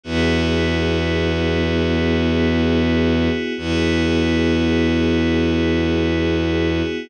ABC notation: X:1
M:3/4
L:1/8
Q:1/4=51
K:Elyd
V:1 name="Pad 5 (bowed)"
[B,EFG]6 | [B,EFG]6 |]
V:2 name="Violin" clef=bass
E,,6 | E,,6 |]